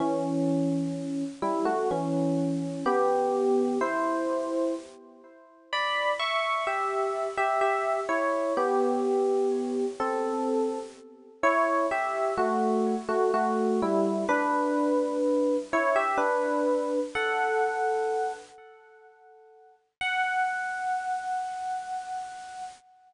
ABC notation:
X:1
M:3/4
L:1/16
Q:1/4=63
K:F#phr
V:1 name="Electric Piano 1"
[E,C]6 [G,E] [A,F] [E,C]4 | [B,G]4 [E=c]4 z4 | [db]2 [ec']2 [Ge]3 [Ge] [Ge]2 [Ec]2 | [B,G]6 [=CA]4 z2 |
[Ec]2 [Ge]2 [A,F]3 [A,F] [A,F]2 [G,E]2 | [DB]6 [Ec] [Ge] [DB]4 | [Af]6 z6 | f12 |]